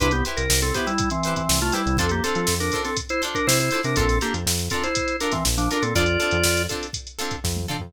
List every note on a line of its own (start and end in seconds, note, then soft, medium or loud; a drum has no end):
0.00 0.22 C2 medium
0.00 0.12 D4 medium
0.00 0.08 E4 medium
0.00 0.08 G4 medium
0.00 0.12 B4 medium
0.00 0.08 B4 medium
0.00 0.08 C5 medium
0.00 kick medium
0.00 closed hi-hat medium
0.11 0.24 B3 medium
0.11 0.24 G4 medium
0.11 closed hi-hat medium
0.25 0.42 E4 medium
0.25 0.42 G4 medium
0.25 0.42 B4 medium
0.25 0.42 C5 medium
0.25 closed hi-hat medium
0.37 0.48 C2 medium
0.37 0.60 A#4 medium
0.37 closed hi-hat medium
0.50 0.72 C2 medium
0.50 snare loud
0.60 0.74 C4 medium
0.60 0.74 A4 medium
0.60 snare soft
0.60 closed hi-hat medium
0.74 0.86 B3 medium
0.74 0.92 E4 medium
0.74 0.86 G4 medium
0.74 0.92 G4 medium
0.74 0.92 B4 medium
0.74 0.92 C5 medium
0.74 kick medium
0.74 closed hi-hat medium
0.87 1.09 G3 medium
0.87 1.09 E4 medium
0.87 closed hi-hat medium
0.98 kick medium
0.98 closed hi-hat medium
1.10 1.34 E3 medium
1.10 1.34 C4 medium
1.10 closed hi-hat medium
1.23 1.42 G4 medium
1.23 1.42 B4 medium
1.23 1.42 C5 medium
1.23 closed hi-hat medium
1.28 1.42 E4 medium
1.36 1.59 E3 medium
1.36 1.59 C4 medium
1.36 kick medium
1.36 closed hi-hat medium
1.49 1.71 C2 medium
1.49 snare loud
1.61 1.74 A3 medium
1.61 1.74 F4 medium
1.61 snare soft
1.61 closed hi-hat medium
1.72 1.97 G3 medium
1.72 1.97 E4 medium
1.72 1.82 E4 medium
1.72 1.82 G4 medium
1.72 1.82 B4 medium
1.72 1.82 C5 medium
1.72 closed hi-hat medium
1.86 1.97 C2 medium
1.86 closed hi-hat medium
1.97 2.21 F2 medium
1.97 2.11 C4 medium
1.97 2.07 D4 medium
1.97 2.07 F4 medium
1.97 2.07 A4 medium
1.97 2.11 A4 medium
1.97 2.07 C5 medium
1.97 kick medium
1.97 closed hi-hat medium
2.09 2.23 A#3 medium
2.09 2.23 G4 medium
2.09 closed hi-hat medium
2.24 2.55 C4 medium
2.24 2.41 D4 medium
2.24 2.41 F4 medium
2.24 2.55 A4 medium
2.24 2.41 A4 medium
2.24 2.41 C5 medium
2.24 closed hi-hat medium
2.35 2.47 F3 medium
2.35 closed hi-hat medium
2.47 2.70 F2 medium
2.47 snare medium
2.60 2.82 D4 medium
2.60 2.82 A#4 medium
2.60 snare soft
2.60 closed hi-hat medium
2.72 2.90 D4 medium
2.72 2.90 F4 medium
2.72 2.90 A4 medium
2.72 2.90 C5 medium
2.72 kick medium
2.72 closed hi-hat medium
2.85 2.97 C4 medium
2.85 2.97 A4 medium
2.85 snare soft
2.85 closed hi-hat medium
2.97 kick medium
2.97 closed hi-hat medium
3.09 3.22 E4 medium
3.09 3.22 C5 medium
3.09 closed hi-hat medium
3.22 3.39 D4 medium
3.22 3.39 F4 medium
3.22 3.39 A4 medium
3.22 3.39 C5 medium
3.22 closed hi-hat medium
3.35 3.47 D4 medium
3.35 3.47 A#4 medium
3.35 kick medium
3.35 closed hi-hat medium
3.47 3.70 C3 medium
3.47 3.59 E4 medium
3.47 3.59 C5 medium
3.47 snare loud
3.60 3.82 E4 medium
3.60 3.82 C5 medium
3.60 snare soft
3.60 closed hi-hat medium
3.71 3.80 D4 medium
3.71 3.80 F4 medium
3.71 3.80 A4 medium
3.71 3.80 C5 medium
3.71 closed hi-hat medium
3.83 3.96 C3 medium
3.83 3.96 D4 medium
3.83 3.96 A#4 medium
3.83 snare soft
3.83 closed hi-hat medium
3.96 4.19 A#1 medium
3.96 4.18 C4 medium
3.96 4.05 D4 medium
3.96 4.05 F4 medium
3.96 4.18 A4 medium
3.96 4.05 A4 medium
3.96 4.05 A#4 medium
3.96 kick medium
3.96 closed hi-hat medium
4.09 snare soft
4.09 closed hi-hat medium
4.21 4.34 A#3 medium
4.21 4.39 D4 medium
4.21 4.39 F4 medium
4.21 4.34 G4 medium
4.21 4.39 A4 medium
4.21 4.39 A#4 medium
4.21 closed hi-hat medium
4.34 4.45 F2 medium
4.34 closed hi-hat medium
4.46 4.69 F2 medium
4.46 snare medium
4.58 snare soft
4.58 closed hi-hat medium
4.70 4.83 C4 medium
4.70 4.88 D4 medium
4.70 4.88 F4 medium
4.70 4.83 A4 medium
4.70 4.88 A4 medium
4.70 4.88 A#4 medium
4.70 kick medium
4.70 closed hi-hat medium
4.83 5.16 E4 medium
4.83 5.16 C5 medium
4.83 closed hi-hat medium
4.95 kick medium
4.95 closed hi-hat medium
5.08 closed hi-hat medium
5.20 5.33 D4 medium
5.20 5.38 D4 medium
5.20 5.38 F4 medium
5.20 5.38 A4 medium
5.20 5.38 A#4 medium
5.20 5.33 A#4 medium
5.20 closed hi-hat medium
5.32 5.44 E3 medium
5.32 5.44 C4 medium
5.32 kick medium
5.32 snare soft
5.32 closed hi-hat medium
5.45 5.68 A#1 medium
5.45 snare medium
5.58 5.69 F3 medium
5.58 5.69 D4 medium
5.58 snare soft
5.58 closed hi-hat medium
5.71 5.83 D4 medium
5.71 5.79 D4 medium
5.71 5.79 F4 medium
5.71 5.79 A4 medium
5.71 5.79 A#4 medium
5.71 5.83 A#4 medium
5.71 closed hi-hat medium
5.82 5.94 A#2 medium
5.82 5.94 C4 medium
5.82 5.94 A4 medium
5.82 closed hi-hat medium
5.95 6.17 F2 medium
5.95 6.04 C4 medium
5.95 6.04 D4 medium
5.95 6.63 F4 medium
5.95 6.04 F4 medium
5.95 6.04 A4 medium
5.95 6.63 D5 loud
5.95 kick medium
5.95 closed hi-hat medium
6.06 closed hi-hat medium
6.20 6.37 C4 medium
6.20 6.37 D4 medium
6.20 6.37 F4 medium
6.20 6.37 A4 medium
6.20 closed hi-hat medium
6.31 6.43 F2 medium
6.31 closed hi-hat medium
6.43 6.67 F2 medium
6.43 snare medium
6.57 snare soft
6.57 closed hi-hat medium
6.69 6.87 C4 medium
6.69 6.87 D4 medium
6.69 6.87 F4 medium
6.69 6.87 A4 medium
6.69 kick medium
6.69 closed hi-hat medium
6.83 closed hi-hat medium
6.93 kick medium
6.93 closed hi-hat medium
7.07 closed hi-hat medium
7.19 7.36 C4 medium
7.19 7.36 D4 medium
7.19 7.36 F4 medium
7.19 7.36 A4 medium
7.19 closed hi-hat medium
7.31 kick medium
7.31 closed hi-hat medium
7.44 7.66 F2 medium
7.44 kick medium
7.44 snare medium
7.57 high tom medium
7.68 7.77 C4 medium
7.68 7.77 D4 medium
7.68 7.77 F4 medium
7.68 7.77 A4 medium
7.68 mid tom medium
7.80 7.92 F2 medium
7.80 floor tom medium